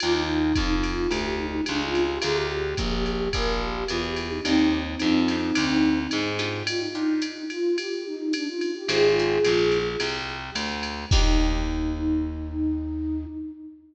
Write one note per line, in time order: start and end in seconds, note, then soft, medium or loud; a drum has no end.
0.00 0.53 D#2 medium
0.00 0.42 D4 medium
0.00 0.42 D#4 medium
0.00 0.13 F4 loud
0.00 0.42 F4 loud
0.00 0.42 G4 loud
0.00 ride loud
0.14 0.73 D#4 loud
0.55 1.07 F2 medium
0.55 kick medium
0.55 hi-hat pedal medium
0.55 ride medium
0.83 1.10 F4 loud
0.83 ride medium
1.11 1.61 D2 medium
1.11 1.36 G4 medium
1.11 ride medium
1.38 1.62 D#4 loud
1.66 2.19 C#2 medium
1.66 1.80 D4 loud
1.66 hi-hat pedal medium
1.66 ride medium
1.80 2.04 F4 loud
1.95 ride medium
2.08 2.22 G4 medium
2.22 2.74 D2 medium
2.22 2.61 D4 loud
2.22 2.61 F4 medium
2.22 2.61 G#4 loud
2.22 2.36 G#4 loud
2.22 2.61 A#4 loud
2.22 ride loud
2.35 2.96 G4 loud
2.77 3.29 A#1 medium
2.77 kick medium
2.77 hi-hat pedal loud
2.77 ride medium
3.06 3.33 G4 medium
3.06 ride medium
3.33 3.84 A#1 medium
3.33 3.60 A#4 medium
3.33 kick medium
3.33 ride loud
3.61 3.87 G4 medium
3.88 4.40 E2 medium
3.88 4.03 F4 loud
3.88 hi-hat pedal medium
3.88 ride medium
4.03 4.29 G4 medium
4.16 ride medium
4.30 4.43 D#4 loud
4.44 4.95 D#2 medium
4.44 6.01 C4 loud
4.44 4.84 D4 medium
4.44 6.01 D#4 loud
4.44 4.84 D#4 loud
4.44 4.84 F4 loud
4.44 4.84 G4 loud
4.44 ride medium
4.99 5.52 F2 medium
4.99 5.21 D4 medium
4.99 5.21 D#4 medium
4.99 5.21 F4 medium
4.99 5.21 G4 medium
4.99 hi-hat pedal medium
4.99 ride medium
5.28 5.50 D4 medium
5.28 5.50 D#4 medium
5.28 5.50 F4 medium
5.28 5.50 G4 medium
5.28 ride medium
5.55 6.07 D2 medium
5.55 5.94 D4 loud
5.55 5.94 D#4 medium
5.55 5.94 F4 medium
5.55 5.94 G4 medium
5.55 ride loud
6.11 6.63 G#2 medium
6.11 hi-hat pedal medium
6.11 ride medium
6.39 6.86 D4 loud
6.39 6.86 D#4 medium
6.39 6.86 F4 loud
6.39 6.86 G4 loud
6.39 ride medium
6.67 6.80 F4 loud
6.67 ride loud
6.80 7.43 D#4 loud
6.95 7.34 D4 medium
6.95 7.34 D#4 medium
6.95 7.34 F4 medium
6.95 7.34 G4 medium
7.22 hi-hat pedal medium
7.22 ride medium
7.50 7.77 F4 loud
7.50 ride medium
7.78 8.04 G4 medium
7.78 ride loud
8.06 8.33 D#4 loud
8.33 8.46 D4 loud
8.33 hi-hat pedal medium
8.33 ride loud
8.47 8.73 F4 medium
8.61 ride medium
8.75 8.88 G4 medium
8.88 9.38 G#1 medium
8.88 9.09 C4 loud
8.88 9.09 D#4 loud
8.88 9.78 F4 medium
8.88 9.09 G4 medium
8.88 9.78 G#4 loud
8.88 9.09 G#4 loud
8.88 ride loud
9.19 9.39 C4 medium
9.19 9.39 D#4 medium
9.19 9.39 G4 loud
9.19 9.39 G#4 medium
9.45 9.96 A#1 medium
9.45 9.84 C4 medium
9.45 9.84 D#4 medium
9.45 9.84 G4 medium
9.45 9.84 G#4 medium
9.45 hi-hat pedal medium
9.45 ride medium
9.72 ride medium
10.00 10.50 C2 medium
10.00 ride loud
10.55 11.05 D2 medium
10.55 hi-hat pedal medium
10.55 ride loud
10.83 ride medium
11.11 13.26 D#2 loud
11.11 13.26 D4 loud
11.11 13.24 D#4 loud
11.11 13.26 D#4 loud
11.11 13.26 F4 loud
11.11 13.26 G4 loud
11.11 kick loud
11.11 crash loud